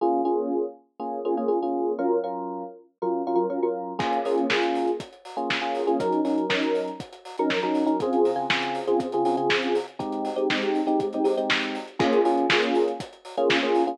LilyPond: <<
  \new Staff \with { instrumentName = "Electric Piano 1" } { \time 4/4 \key bes \minor \tempo 4 = 120 <bes des' f' aes'>8 <bes des' f' aes'>4. <bes des' f' aes'>8 <bes des' f' aes'>16 <bes des' f' aes'>16 <bes des' f' aes'>16 <bes des' f' aes'>8. | <ges des' f' bes'>8 <ges des' f' bes'>4. <ges des' f' bes'>8 <ges des' f' bes'>16 <ges des' f' bes'>16 <ges des' f' bes'>16 <ges des' f' bes'>8. | <bes des' f' aes'>8 <bes des' f' aes'>8 <bes des' f' aes'>4.~ <bes des' f' aes'>16 <bes des' f' aes'>8 <bes des' f' aes'>8 <bes des' f' aes'>16 | <ges des' ees' bes'>8 <ges des' ees' bes'>8 <ges des' ees' bes'>4.~ <ges des' ees' bes'>16 <ges des' ees' bes'>8 <ges des' ees' bes'>8 <ges des' ees' bes'>16 |
<des c' f' aes'>8. <des c' f' aes'>16 <des c' f' aes'>8. <des c' f' aes'>8 <des c' f' aes'>16 <des c' f' aes'>16 <des c' f' aes'>4~ <des c' f' aes'>16 | <aes c' ees' g'>8. <aes c' ees' g'>16 <aes c' ees' g'>8. <aes c' ees' g'>8 <aes c' ees' g'>16 <aes c' ees' g'>16 <aes c' ees' g'>4~ <aes c' ees' g'>16 | <bes des' f' aes'>8 <bes des' f' aes'>8 <bes des' f' aes'>4.~ <bes des' f' aes'>16 <bes des' f' aes'>8 <bes des' f' aes'>8 <bes des' f' aes'>16 | }
  \new DrumStaff \with { instrumentName = "Drums" } \drummode { \time 4/4 r4 r4 r4 r4 | r4 r4 r4 r4 | <cymc bd>16 hh16 hho16 hh16 <bd sn>16 hh16 hho16 hh16 <hh bd>16 hh16 hho16 hh16 <bd sn>8 hho16 hh16 | <hh bd>16 hh16 hho16 hh16 <bd sn>16 hh16 hho16 hh16 <hh bd>16 hh16 hho16 hh16 <bd sn>16 hh16 hho16 hh16 |
<hh bd>16 hh16 hho8 <bd sn>16 hh16 hho16 hh16 <hh bd>16 hh16 hho16 hh16 <bd sn>16 hh16 hho16 hh16 | <hh bd>16 hh16 hho16 hh16 <bd sn>16 hh16 hho16 hh16 <hh bd>16 hh16 hho16 hh16 <bd sn>16 hh16 hho16 hh16 | <cymc bd>16 hh16 hho16 hh16 <bd sn>16 hh16 hho16 hh16 <hh bd>16 hh16 hho16 hh16 <bd sn>8 hho16 hh16 | }
>>